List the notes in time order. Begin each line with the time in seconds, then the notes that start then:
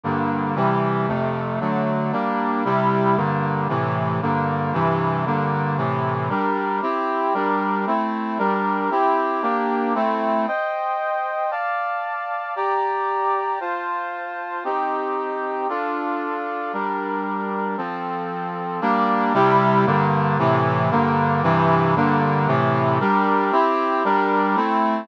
0.03 G2 D3 A#3
0.56 C3 E3 G3
1.08 F2 C3 A3
1.60 D3 F#3 A3
2.12 G3 A#3 D4
2.65 C3 G3 E4
3.16 G2 D3 A#3
3.69 A2 C3 E3
4.22 G2 D3 A#3
4.73 G2 C3 E3
5.26 G2 D3 A#3
5.77 A2 C3 E3
6.29 G3 D4 A#4
6.82 C4 E4 G4
7.34 G3 D4 A#4
7.87 A3 C4 E4
8.38 G3 D4 A#4
8.91 C4 E4 G4
9.42 A#3 D4 G4
9.95 A3 C4 E4
10.47 C5 D#5 G5
11.51 D5 F5 A5
12.56 G4 D5 A#5
13.60 F4 C5 A5
14.64 C4 D#4 G4
15.69 D4 F4 A4
16.73 G3 D4 A#4
17.77 F3 C4 A4
18.81 G3 A#3 D4
19.34 C3 G3 E4
19.86 G2 D3 A#3
20.38 A2 C3 E3
20.91 G2 D3 A#3
21.43 G2 C3 E3
21.96 G2 D3 A#3
22.47 A2 C3 E3
23.00 G3 D4 A#4
23.52 C4 E4 G4
24.04 G3 D4 A#4
24.56 A3 C4 E4